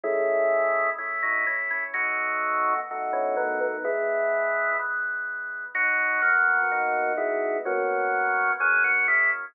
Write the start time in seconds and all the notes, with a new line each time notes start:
0.04 G#3 A3 C#4 E4
0.98 A3 C#4 E4
1.23 F#3 D#4
1.47 E3 C#4
1.71 E3 C#4
1.94 B2 F#3 A3 D#4 F#4
2.91 B2 A3 D#4 F#4
3.13 E3 C#4
3.37 D#3 B3
3.61 D#3 B3
3.84 E3 G#3 B3 E4
4.79 E3 G#3 B3
5.75 F#3 B3 D#4 F#4
6.22 A#3 F#4
6.72 B3 D#4 F#4
7.17 G#3 E4
7.65 F#3 A#3 B3 C#4 F#4
8.60 F#3 A#3 B3 C#4 G#4
8.84 A#3 F#4
9.08 G#3 E4